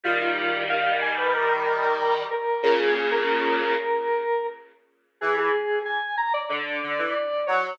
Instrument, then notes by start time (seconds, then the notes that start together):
lead 1 (square)
0.03 D#3 G3 F4
0.21 F4
0.69 F5
1.01 G#5
1.17 B4
1.34 A#4
2.30 A#4
2.62 A#2 C#3 A#4
2.79 G#4
2.95 G#4
3.11 A#4
5.21 E3 G#4
5.37 G#4
5.85 G#5
6.17 A#5
6.33 D5
6.49 D3 D5
6.83 D3
6.98 E3
7.46 F#3 C#5